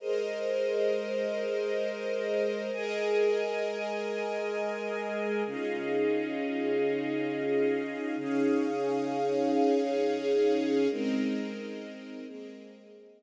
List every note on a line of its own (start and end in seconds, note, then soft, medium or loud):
0.00 2.70 G#3 medium
0.00 2.71 G#4 medium
0.00 2.70 A#4 medium
0.00 2.71 A#4 medium
0.00 2.70 C5 medium
0.00 2.71 C5 medium
0.00 2.70 D#5 medium
0.00 2.71 D#5 medium
2.73 5.43 G#3 medium
2.73 5.43 G#4 medium
2.73 5.43 A#4 medium
2.73 5.43 D#5 medium
2.73 5.43 G#5 medium
5.45 8.16 C#3 medium
5.45 8.16 C#4 medium
5.45 8.16 D#4 medium
5.45 8.16 F4 medium
5.45 8.16 G#4 medium
5.45 8.16 D#5 medium
5.45 8.16 F5 medium
8.18 10.88 C#3 medium
8.18 10.88 C#4 medium
8.18 10.88 D#4 medium
8.18 10.88 G#4 medium
8.18 10.88 C#5 medium
8.18 10.88 F5 medium
10.90 12.25 G#3 medium
10.90 12.26 G#3 medium
10.90 12.25 C4 medium
10.90 12.26 C4 medium
10.90 12.25 D#4 medium
10.90 12.25 A#4 medium
10.90 12.26 A#4 medium
10.90 12.26 D#5 medium
12.27 13.23 G#3 medium
12.27 13.23 A#3 medium
12.27 13.23 C4 medium
12.27 13.23 G#4 medium
12.27 13.23 A#4 medium
12.27 13.23 D#5 medium